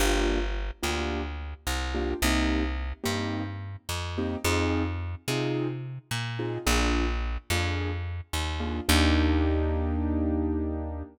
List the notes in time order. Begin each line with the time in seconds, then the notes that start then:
0.00 G1 A#3 D4 F4 G4
0.83 D2 A#3 D4 F4 G4
1.67 C2
1.95 A#3 D4 F4 G4
2.22 C2 A#3 C4 D#4 G4
3.04 G2 A#3 C4 D#4 G4
3.89 F2
4.18 A#3 C4 D#4 G4
4.44 F2 C4 D#4 F4 G#4
5.28 C3 C4 D#4 F4 G#4
6.11 A#2
6.39 C4 D#4 F4 G#4
6.66 A#1 A#3 D4 F4 G#4
7.50 F2 A#3 D4 F4 G#4
8.33 D#2
8.60 A#3 D4 F4 G#4
8.89 D#2 A#3 D4 D#4 G4